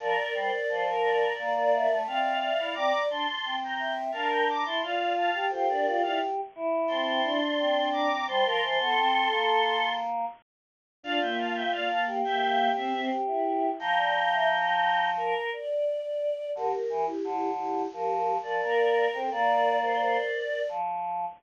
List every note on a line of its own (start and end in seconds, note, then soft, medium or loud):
0.00 0.16 F3 loud
0.00 0.87 A#4 medium
0.00 0.34 A#4 medium
0.00 0.87 D5 medium
0.34 0.51 G3 loud
0.34 0.51 C5 medium
0.51 0.67 D5 medium
0.69 1.28 F3 medium
0.69 0.85 C5 medium
0.86 1.33 A#4 medium
1.03 1.98 A#4 medium
1.03 1.98 D5 medium
1.38 1.87 A#3 loud
1.38 1.54 D5 medium
1.55 1.72 D5 medium
1.72 2.37 E5 medium
1.90 2.06 A3 medium
2.07 2.51 C4 loud
2.07 2.75 D5 medium
2.07 2.75 F5 medium
2.41 2.73 E5 medium
2.58 2.75 E4 medium
2.74 2.92 C4 loud
2.74 3.08 D5 medium
2.74 3.02 A#5 medium
2.74 3.02 D6 medium
3.10 3.26 D4 medium
3.10 3.55 A5 medium
3.10 3.55 C6 medium
3.45 4.11 C4 medium
3.64 3.92 G5 medium
3.64 3.92 A#5 medium
3.79 4.11 E5 medium
4.12 4.64 D4 medium
4.12 4.44 A#4 medium
4.12 4.28 F5 medium
4.12 4.28 A5 medium
4.31 4.47 G5 medium
4.31 4.47 A#5 medium
4.49 4.66 A#5 medium
4.49 4.66 D6 medium
4.66 4.82 E4 loud
4.66 4.82 A5 medium
4.66 4.82 C6 medium
4.83 5.30 F4 loud
4.83 5.13 D5 medium
4.83 5.13 F5 medium
5.17 5.45 F5 medium
5.17 5.45 A5 medium
5.34 5.51 G4 medium
5.50 5.68 F4 medium
5.50 6.41 G4 loud
5.50 5.66 A4 medium
5.50 5.66 C5 medium
5.69 5.86 D4 medium
5.69 6.02 A#4 medium
5.69 6.02 D5 medium
5.86 6.03 F4 medium
6.02 6.20 E4 medium
6.02 6.19 D5 medium
6.02 6.19 F5 medium
6.55 7.39 E4 loud
6.88 7.20 C4 medium
6.88 7.88 A5 medium
6.88 7.88 C6 medium
7.25 8.08 D4 medium
7.59 8.26 C4 medium
7.92 8.26 A#5 medium
7.92 8.26 D6 medium
8.27 8.44 G3 loud
8.27 8.44 C5 medium
8.27 9.93 A5 medium
8.27 9.93 C6 medium
8.45 8.61 F3 medium
8.45 8.62 A#4 medium
8.62 8.79 E3 medium
8.62 8.78 C5 medium
8.79 8.96 B3 medium
8.79 9.85 A4 medium
8.96 9.28 C4 loud
9.31 10.25 A#3 medium
11.03 11.20 D4 medium
11.03 11.91 F4 loud
11.03 11.20 D5 medium
11.03 11.20 F5 loud
11.21 11.68 A#3 medium
11.21 11.37 E5 medium
11.21 11.37 G5 medium
11.39 11.55 F5 medium
11.39 11.55 A5 medium
11.54 11.71 E5 medium
11.54 11.71 G5 medium
11.72 12.21 A#3 medium
11.72 11.88 D5 medium
11.72 11.88 F5 medium
11.89 12.05 F5 medium
11.89 12.05 A5 medium
12.07 13.01 G4 loud
12.24 12.69 A#3 medium
12.24 12.69 E5 medium
12.24 12.69 G5 medium
12.76 12.93 C4 medium
12.76 13.05 C5 medium
12.76 13.05 E5 medium
12.93 13.10 C4 medium
13.10 13.70 G4 medium
13.27 13.69 E4 medium
13.79 15.34 F3 loud
13.79 13.96 F5 medium
13.79 15.07 G5 medium
13.79 15.07 A#5 loud
13.97 14.14 D5 medium
14.15 14.31 F5 medium
14.31 14.48 E5 medium
15.17 15.50 A#4 medium
15.53 16.50 D5 medium
16.55 16.72 D3 loud
16.55 17.04 G4 medium
16.55 17.04 A#4 medium
16.89 17.06 E3 loud
17.05 17.50 E4 medium
17.05 17.50 G4 medium
17.24 17.82 D3 loud
17.58 17.86 E4 medium
17.58 17.86 G4 medium
17.93 18.37 F3 loud
17.93 18.35 G4 medium
17.93 18.35 A#4 medium
18.43 18.61 F3 loud
18.43 19.06 A#4 medium
18.43 19.06 D5 medium
18.62 19.07 A#3 medium
18.62 19.18 A#4 medium
19.14 19.30 C4 loud
19.14 19.30 A4 medium
19.14 19.30 C5 medium
19.31 20.17 A#3 loud
19.31 20.60 A#4 medium
19.31 20.60 D5 medium
19.31 19.78 D5 medium
19.83 20.28 C5 medium
20.35 20.69 D5 medium
20.69 21.25 F3 loud